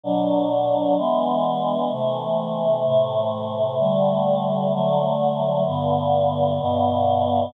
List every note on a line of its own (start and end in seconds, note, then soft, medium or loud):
0.04 0.96 B2 medium
0.04 0.96 F#3 medium
0.04 0.96 D4 medium
0.97 1.90 E3 medium
0.97 1.90 G#3 medium
0.97 1.90 B3 medium
1.91 2.84 C3 medium
1.91 2.84 E3 medium
1.91 2.84 A3 medium
2.85 3.78 A2 medium
2.85 3.78 C3 medium
2.85 3.78 A3 medium
3.79 4.71 D3 medium
3.79 4.71 G3 medium
3.79 4.71 A3 medium
4.72 5.65 D3 medium
4.72 5.65 F#3 medium
4.72 5.65 A3 medium
5.66 6.59 G2 medium
5.66 6.59 D3 medium
5.66 6.59 B3 medium
6.60 7.53 G2 medium
6.60 7.53 B2 medium
6.60 7.53 B3 medium